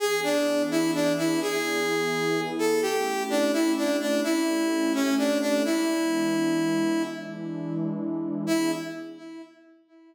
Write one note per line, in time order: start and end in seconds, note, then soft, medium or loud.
0.00 1.40 E3 medium
0.00 1.40 B3 medium
0.00 1.40 D4 medium
0.00 0.20 G#4 loud
0.00 1.40 G#4 medium
0.23 0.62 D4 medium
0.71 0.91 E4 loud
0.94 1.13 D4 loud
1.18 1.40 E4 loud
1.41 2.81 E3 medium
1.41 2.81 B3 medium
1.41 2.81 E4 medium
1.41 2.41 G#4 loud
1.41 2.81 G#4 medium
2.59 2.81 A4 loud
2.82 4.22 A3 medium
2.82 4.22 C#4 medium
2.82 4.22 E4 medium
2.82 3.23 G4 loud
2.82 4.22 G4 medium
3.30 3.52 D4 loud
3.53 3.72 E4 loud
3.77 3.97 D4 medium
4.00 4.21 D4 medium
4.23 5.63 A3 medium
4.23 5.63 C#4 medium
4.23 4.93 E4 loud
4.23 5.63 G4 medium
4.23 5.63 A4 medium
4.94 5.15 C#4 loud
5.18 5.38 D4 loud
5.41 5.63 D4 loud
5.65 7.05 E3 medium
5.65 7.05 G#3 medium
5.65 7.05 B3 medium
5.65 7.05 D4 medium
5.65 7.03 E4 loud
7.06 8.46 E3 medium
7.06 8.46 G#3 medium
7.06 8.46 D4 medium
7.06 8.46 E4 medium
8.47 8.72 E3 loud
8.47 8.72 B3 loud
8.47 8.72 D4 loud
8.47 8.71 E4 loud
8.47 8.72 G#4 loud